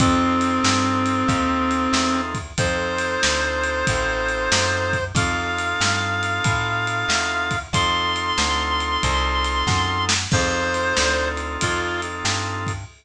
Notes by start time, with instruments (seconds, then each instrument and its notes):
0.00 electric bass (finger) F2, clarinet C4, drawbar organ C4 D#4 F4 A4, kick, ride
0.41 ride
0.64 electric bass (finger) G2, snare
1.06 ride
1.28 electric bass (finger) D#2, kick, ride
1.71 ride
1.93 electric bass (finger) E2, snare
2.35 kick, ride
2.58 electric bass (finger) F2, drawbar organ C4 D#4 F4 A4, clarinet C5, kick, ride
2.98 ride
3.23 electric bass (finger) D2, snare
3.64 ride
3.87 electric bass (finger) A1, kick, ride
4.28 ride
4.52 electric bass (finger) F#2, snare
4.93 kick, ride
5.15 electric bass (finger) F2, drawbar organ C4 D#4 F4 A4, clarinet F5, kick, ride
5.58 ride
5.81 electric bass (finger) G2, snare
6.23 ride
6.44 electric bass (finger) A2, kick, ride
6.87 ride
7.08 electric bass (finger) E2, snare
7.51 kick, ride
7.73 electric bass (finger) F2, drawbar organ C4 D#4 F4 A4, clarinet C6, kick, ride
8.16 ride
8.38 electric bass (finger) D2, snare
8.80 ride
9.03 electric bass (finger) C2, kick, ride
9.44 ride
9.67 electric bass (finger) F#2, kick, snare
10.09 snare
10.31 electric bass (finger) F2, drawbar organ C4 D#4 F4 A4, clarinet C5, kick, crash
10.74 ride
10.97 electric bass (finger) D2, snare
11.37 ride
11.61 electric bass (finger) F2, clarinet F4, kick, ride
12.02 ride
12.25 electric bass (finger) G2, snare
12.67 kick, ride